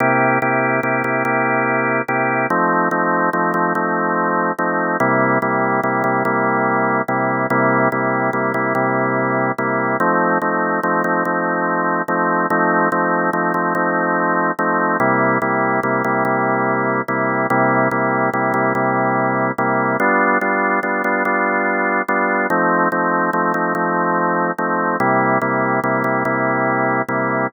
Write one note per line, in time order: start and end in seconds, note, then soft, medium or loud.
0.00 0.39 C3 loud
0.00 0.39 A#3 loud
0.00 0.39 E4 medium
0.00 0.39 G4 medium
0.42 0.80 C3 medium
0.42 0.80 A#3 medium
0.42 0.80 E4 medium
0.42 0.80 G4 medium
0.83 1.02 C3 medium
0.83 1.02 A#3 medium
0.83 1.02 E4 medium
0.83 1.02 G4 medium
1.04 1.23 C3 medium
1.04 1.23 A#3 medium
1.04 1.23 E4 medium
1.04 1.23 G4 medium
1.25 2.02 C3 medium
1.25 2.02 A#3 medium
1.25 2.02 E4 medium
1.25 2.02 G4 medium
2.08 2.47 C3 medium
2.08 2.47 A#3 medium
2.08 2.47 E4 medium
2.08 2.47 G4 medium
2.50 2.89 F3 medium
2.50 2.89 A3 medium
2.50 2.89 C4 medium
2.50 2.89 D#4 medium
2.91 3.30 F3 medium
2.91 3.30 A3 medium
2.91 3.30 C4 medium
2.91 3.30 D#4 medium
3.33 3.52 F3 medium
3.33 3.52 A3 medium
3.33 3.52 C4 medium
3.33 3.52 D#4 medium
3.54 3.73 F3 medium
3.54 3.73 A3 medium
3.54 3.73 C4 medium
3.54 3.73 D#4 medium
3.75 4.52 F3 medium
3.75 4.52 A3 medium
3.75 4.52 C4 medium
3.75 4.52 D#4 medium
4.59 4.97 F3 medium
4.59 4.97 A3 medium
4.59 4.97 C4 medium
4.59 4.97 D#4 medium
5.00 5.38 C3 loud
5.00 5.38 G3 medium
5.00 5.38 A#3 medium
5.00 5.38 E4 loud
5.42 5.80 C3 medium
5.42 5.80 G3 medium
5.42 5.80 A#3 medium
5.42 5.80 E4 medium
5.83 6.03 C3 medium
5.83 6.03 G3 medium
5.83 6.03 A#3 medium
5.83 6.03 E4 medium
6.04 6.23 C3 medium
6.04 6.23 G3 medium
6.04 6.23 A#3 medium
6.04 6.23 E4 medium
6.25 7.02 C3 medium
6.25 7.02 G3 medium
6.25 7.02 A#3 medium
6.25 7.02 E4 medium
7.08 7.47 C3 medium
7.08 7.47 G3 medium
7.08 7.47 A#3 medium
7.08 7.47 E4 medium
7.50 7.89 C3 loud
7.50 7.89 G3 medium
7.50 7.89 A#3 loud
7.50 7.89 E4 medium
7.92 8.30 C3 medium
7.92 8.30 G3 medium
7.92 8.30 A#3 medium
7.92 8.30 E4 medium
8.33 8.52 C3 medium
8.33 8.52 G3 medium
8.33 8.52 A#3 medium
8.33 8.52 E4 medium
8.54 8.73 C3 medium
8.54 8.73 G3 medium
8.54 8.73 A#3 medium
8.54 8.73 E4 medium
8.75 9.52 C3 medium
8.75 9.52 G3 medium
8.75 9.52 A#3 medium
8.75 9.52 E4 medium
9.58 9.97 C3 medium
9.58 9.97 G3 medium
9.58 9.97 A#3 medium
9.58 9.97 E4 medium
10.00 10.38 F3 medium
10.00 10.38 A3 medium
10.00 10.38 C4 medium
10.00 10.38 D#4 medium
10.42 10.80 F3 medium
10.42 10.80 A3 medium
10.42 10.80 C4 medium
10.42 10.80 D#4 medium
10.83 11.03 F3 medium
10.83 11.03 A3 medium
10.83 11.03 C4 medium
10.83 11.03 D#4 medium
11.04 11.23 F3 medium
11.04 11.23 A3 medium
11.04 11.23 C4 medium
11.04 11.23 D#4 medium
11.25 12.02 F3 medium
11.25 12.02 A3 medium
11.25 12.02 C4 medium
11.25 12.02 D#4 medium
12.08 12.47 F3 medium
12.08 12.47 A3 medium
12.08 12.47 C4 medium
12.08 12.47 D#4 medium
12.50 12.89 F3 medium
12.50 12.89 A3 medium
12.50 12.89 C4 medium
12.50 12.89 D#4 loud
12.92 13.30 F3 medium
12.92 13.30 A3 medium
12.92 13.30 C4 medium
12.92 13.30 D#4 medium
13.33 13.52 F3 medium
13.33 13.52 A3 medium
13.33 13.52 C4 medium
13.33 13.52 D#4 medium
13.54 13.73 F3 medium
13.54 13.73 A3 medium
13.54 13.73 C4 medium
13.54 13.73 D#4 medium
13.75 14.51 F3 medium
13.75 14.51 A3 medium
13.75 14.51 C4 medium
13.75 14.51 D#4 medium
14.59 14.97 F3 medium
14.59 14.97 A3 medium
14.59 14.97 C4 medium
14.59 14.97 D#4 medium
15.00 15.38 C3 medium
15.00 15.38 G3 medium
15.00 15.38 A#3 medium
15.00 15.38 E4 loud
15.42 15.80 C3 medium
15.42 15.80 G3 medium
15.42 15.80 A#3 medium
15.42 15.80 E4 medium
15.83 16.02 C3 medium
15.83 16.02 G3 medium
15.83 16.02 A#3 medium
15.83 16.02 E4 medium
16.04 16.24 C3 medium
16.04 16.24 G3 medium
16.04 16.24 A#3 medium
16.04 16.24 E4 medium
16.25 17.01 C3 medium
16.25 17.01 G3 medium
16.25 17.01 A#3 medium
16.25 17.01 E4 medium
17.08 17.47 C3 medium
17.08 17.47 G3 medium
17.08 17.47 A#3 medium
17.08 17.47 E4 medium
17.50 17.88 C3 loud
17.50 17.88 G3 medium
17.50 17.88 A#3 medium
17.50 17.88 E4 medium
17.91 18.30 C3 medium
17.91 18.30 G3 medium
17.91 18.30 A#3 medium
17.91 18.30 E4 medium
18.33 18.53 C3 medium
18.33 18.53 G3 medium
18.33 18.53 A#3 medium
18.33 18.53 E4 medium
18.54 18.73 C3 medium
18.54 18.73 G3 medium
18.54 18.73 A#3 medium
18.54 18.73 E4 medium
18.75 19.52 C3 medium
18.75 19.52 G3 medium
18.75 19.52 A#3 medium
18.75 19.52 E4 medium
19.58 19.97 C3 medium
19.58 19.97 G3 medium
19.58 19.97 A#3 medium
19.58 19.97 E4 medium
20.00 20.38 G3 medium
20.00 20.38 B3 loud
20.00 20.38 D4 medium
20.00 20.38 F4 medium
20.41 20.80 G3 medium
20.41 20.80 B3 medium
20.41 20.80 D4 medium
20.41 20.80 F4 medium
20.83 21.02 G3 medium
20.83 21.02 B3 medium
20.83 21.02 D4 medium
20.83 21.02 F4 medium
21.04 21.23 G3 medium
21.04 21.23 B3 medium
21.04 21.23 D4 medium
21.04 21.23 F4 medium
21.25 22.02 G3 medium
21.25 22.02 B3 medium
21.25 22.02 D4 medium
21.25 22.02 F4 medium
22.08 22.47 G3 medium
22.08 22.47 B3 medium
22.08 22.47 D4 medium
22.08 22.47 F4 medium
22.50 22.88 F3 medium
22.50 22.88 A3 medium
22.50 22.88 C4 medium
22.50 22.88 D#4 medium
22.92 23.30 F3 medium
22.92 23.30 A3 medium
22.92 23.30 C4 medium
22.92 23.30 D#4 medium
23.33 23.52 F3 medium
23.33 23.52 A3 medium
23.33 23.52 C4 medium
23.33 23.52 D#4 medium
23.54 23.73 F3 medium
23.54 23.73 A3 medium
23.54 23.73 C4 medium
23.54 23.73 D#4 medium
23.75 24.51 F3 medium
23.75 24.51 A3 medium
23.75 24.51 C4 medium
23.75 24.51 D#4 medium
24.58 24.97 F3 medium
24.58 24.97 A3 medium
24.58 24.97 C4 medium
24.58 24.97 D#4 medium
25.00 25.38 C3 medium
25.00 25.38 G3 loud
25.00 25.38 A#3 medium
25.00 25.38 E4 medium
25.41 25.80 C3 medium
25.41 25.80 G3 medium
25.41 25.80 A#3 medium
25.41 25.80 E4 medium
25.84 26.03 C3 medium
25.84 26.03 G3 medium
25.84 26.03 A#3 medium
25.84 26.03 E4 medium
26.04 26.23 C3 medium
26.04 26.23 G3 medium
26.04 26.23 A#3 medium
26.04 26.23 E4 medium
26.25 27.02 C3 medium
26.25 27.02 G3 medium
26.25 27.02 A#3 medium
26.25 27.02 E4 medium
27.09 27.47 C3 medium
27.09 27.47 G3 medium
27.09 27.47 A#3 medium
27.09 27.47 E4 medium